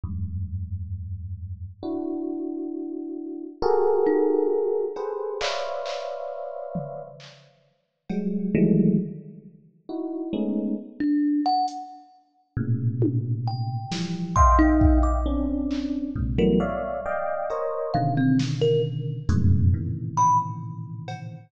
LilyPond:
<<
  \new Staff \with { instrumentName = "Electric Piano 1" } { \time 6/4 \tempo 4 = 67 <e, ges, g, aes,>2 <d' e' ges'>2 <ges' g' aes' a' bes'>4. <g' aes' a' b' c''>8 | <b' c'' des'' d'' e'' f''>2 r4 <ges g aes>8 <ees e ges g aes a>8 r4 <ees' e' ges'>8 <aes a b des' ees'>8 | r2 <a, bes, b, des>4. <e f g>8 <ees'' e'' f'' g''>4 <c' des' d'>4 | <aes, bes, c>16 <e ges g a b>16 <des'' d'' e'' f''>8 <d'' ees'' f'' g''>8 <bes' c'' des'' ees''>8 <b, des d ees>4. <f, ges, aes, a, b, des>8 <a, bes, c des ees e>2 | }
  \new Staff \with { instrumentName = "Kalimba" } { \time 6/4 r1 r8 ees'8 r4 | r1. | r16 d'8 ges''16 r2 g''8 r8 c'''16 ees'8 d'''16 r4 | r16 bes'16 r4. f''16 c'16 r16 bes'16 r4. b''16 r4 r16 | }
  \new DrumStaff \with { instrumentName = "Drums" } \drummode { \time 6/4 r4 r4 r4 r4 r4 r8 cb8 | hc8 hc8 r8 tomfh8 hc4 cb4 tomfh4 r4 | r4 hh4 r8 tommh8 r8 sn8 bd8 bd8 r8 hc8 | bd4 r8 cb8 r8 sn8 r8 hh8 r8 cb8 r8 cb8 | }
>>